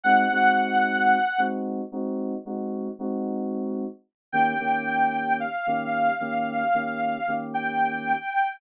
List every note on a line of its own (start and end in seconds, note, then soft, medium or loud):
0.04 0.25 G#3 loud
0.04 0.25 C4 loud
0.04 0.25 D#4 loud
0.04 0.25 F#4 medium
0.04 1.40 F#5 loud
0.31 1.17 G#3 loud
0.31 1.17 C4 medium
0.31 1.17 D#4 medium
0.31 1.17 F#4 loud
1.38 1.81 G#3 loud
1.38 1.81 C4 loud
1.38 1.81 D#4 medium
1.38 1.81 F#4 loud
1.92 2.34 G#3 medium
1.92 2.34 C4 loud
1.92 2.34 D#4 loud
1.92 2.34 F#4 medium
2.45 2.88 G#3 loud
2.45 2.88 C4 medium
2.45 2.88 D#4 medium
2.45 2.88 F#4 loud
2.99 3.84 G#3 loud
2.99 3.84 C4 loud
2.99 3.84 D#4 loud
2.99 3.84 F#4 loud
4.32 4.54 D#3 loud
4.32 4.54 A#3 loud
4.32 4.54 C#4 loud
4.32 4.54 G4 loud
4.32 5.33 G5 loud
4.59 5.45 D#3 medium
4.59 5.45 A#3 loud
4.59 5.45 C#4 loud
4.59 5.45 G4 loud
5.40 7.34 F5 medium
5.67 6.09 D#3 loud
5.67 6.09 A#3 loud
5.67 6.09 C#4 loud
5.67 6.09 G4 loud
6.20 6.63 D#3 medium
6.20 6.63 A#3 loud
6.20 6.63 C#4 loud
6.20 6.63 G4 loud
6.74 7.17 D#3 medium
6.74 7.17 A#3 medium
6.74 7.17 C#4 loud
6.74 7.17 G4 medium
7.27 8.13 D#3 medium
7.27 8.13 A#3 medium
7.27 8.13 C#4 medium
7.27 8.13 G4 loud
7.54 8.54 G5 medium